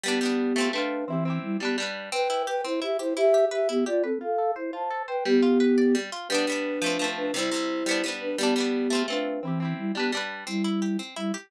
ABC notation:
X:1
M:6/8
L:1/8
Q:3/8=115
K:G
V:1 name="Flute"
[B,G]4 [DB]2 | [E,C]2 [G,E] [B,G] z2 | [K:C] [Bg]2 [Bg] [Ec] [Ge] [Ec] | [Ge]2 [Ge] [B,G] [Fd] [CA] |
[Af]2 [Ec] [ca]2 [Bg] | [B,G]5 z | [K:G] [DB]5 [DB] | [Ec]5 [DB] |
[B,G]4 [DB]2 | [E,C]2 [G,E] [B,G] z2 | [K:C] [G,E]3 z [G,E] z |]
V:2 name="Acoustic Guitar (steel)"
[G,B,D] [G,B,D]2 [A,C=F] [A,CF]2 | [CEG] [CEG]2 [G,DB] [G,DB]2 | [K:C] C E G C E G | E G B E G B |
F A c F A c | G, F B d G, F | [K:G] [G,B,D] [G,B,D]2 [=F,A,C] [F,A,C]2 | [C,G,E] [C,G,E]2 [G,B,D] [G,B,D]2 |
[G,B,D] [G,B,D]2 [A,C=F] [A,CF]2 | [CEG] [CEG]2 [G,DB] [G,DB]2 | [K:C] C E G C E G |]